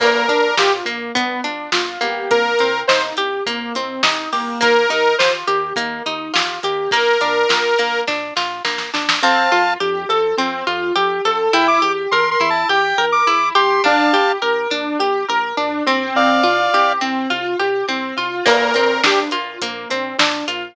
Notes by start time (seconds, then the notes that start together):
0.00 A#1 A#3 A#4, kick, crash
0.29 A#1 D4, kick, closed hi-hat
0.57 A#1 F4 G4, snare
0.85 A#1 A#3, closed hi-hat
1.15 G1 B3, kick, closed hi-hat
1.44 G1 D4, closed hi-hat
1.72 G1 F4, snare
2.01 G1 A#3 G4, closed hi-hat
2.30 C2 A#3 A#4, kick, closed hi-hat
2.59 C2 C4, closed hi-hat
2.88 C2 D#4 C5, snare
3.17 C2 G4, closed hi-hat
3.46 C2 A#3, kick, closed hi-hat
3.75 C2 C4, closed hi-hat
4.03 C2 D#4, snare
4.32 C2 A#3 G4, open hi-hat
4.61 D#2 A#3 A#4, kick, closed hi-hat
4.89 D#2 D#4, closed hi-hat
5.18 D#2 F4 C5, snare
5.47 D#2 G4, closed hi-hat
5.76 D#2 A#3, kick, closed hi-hat
6.06 D#2 D#4, closed hi-hat
6.33 D#2 F4, snare
6.63 D#2 G4, closed hi-hat
6.91 A#1 A#3 A#4, kick, closed hi-hat
7.21 A#1 D4, closed hi-hat
7.49 A#1 F4, snare
7.78 A#1 A#3, closed hi-hat
8.07 A#1 D4, kick, snare
8.37 A#1 F4, snare
8.65 A#1 A#3, snare
8.78 snare
8.94 A#1 D4, snare
9.09 snare
9.22 F2 C4 F5 A5
9.52 F2 F4
9.80 F2 G4
10.09 F2 A4
10.37 F2 C4
10.67 F2 F4
10.96 F2 G4
11.25 F2 A4
11.53 E2 E4 G5
11.68 D6
11.82 E2 G4
12.11 E2 A#4 C6
12.31 C6
12.40 E2 E4
12.50 A5
12.69 E2 G4 G5
12.98 E2 A#4
13.12 D6
13.27 E2 E4
13.55 E2 G4 C6
13.84 A#1 D4 F5 A5
14.13 A#1 G4
14.42 A#1 A#4
14.71 A#1 D4
14.99 A#1 G4
15.28 A#1 A#4
15.57 A#1 D4
15.87 A#1 C4
16.15 C2 D5 F5
16.44 C2 F4
16.73 C2 G4
17.01 C2 C4
17.30 C2 F4
17.59 C2 G4
17.88 C2 C4
18.17 C2 F4
18.46 A#1 A#3 A#4, kick, crash
18.74 A#1 C4, closed hi-hat
19.04 A#1 D4 G4, snare
19.31 A#1 F4, closed hi-hat
19.62 A#1 A#3, kick, closed hi-hat
19.90 A#1 C4, closed hi-hat
20.19 A#1 D4, snare
20.48 A#1 F4, closed hi-hat